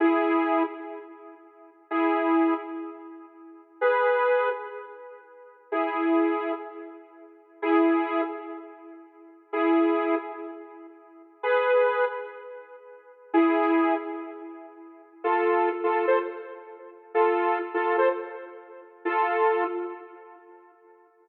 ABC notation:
X:1
M:4/4
L:1/16
Q:1/4=126
K:G#m
V:1 name="Lead 2 (sawtooth)"
[EG]6 z10 | [EG]6 z10 | [GB]6 z10 | [EG]8 z8 |
[EG]6 z10 | [EG]6 z10 | [GB]6 z10 | [EG]6 z10 |
[K:Am] [FA]4 z [FA]2 [Ac] z8 | [FA]4 z [FA]2 [Ac] z8 | [FA]6 z10 |]